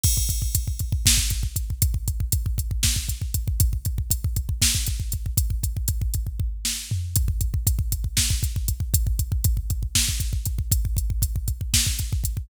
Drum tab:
CC |x-------------|--------------|--------------|--------------|
HH |--x-x-x---x-x-|x-x-x-x---x-x-|x-x-x-x---x-x-|x-x-x-x-------|
SD |--------o-----|--------o-----|--------o-----|----------o---|
FT |--------------|--------------|--------------|------------o-|
BD |oooooooooooooo|oooooooooooooo|oooooooooooooo|ooooooooo-----|

CC |--------------|--------------|--------------|
HH |x-x-x-x---x-x-|x-x-x-x---x-x-|x-x-x-x---x-x-|
SD |--------o-----|--------o-----|--------o-----|
FT |--------------|--------------|--------------|
BD |oooooooooooooo|oooooooooooooo|oooooooooooooo|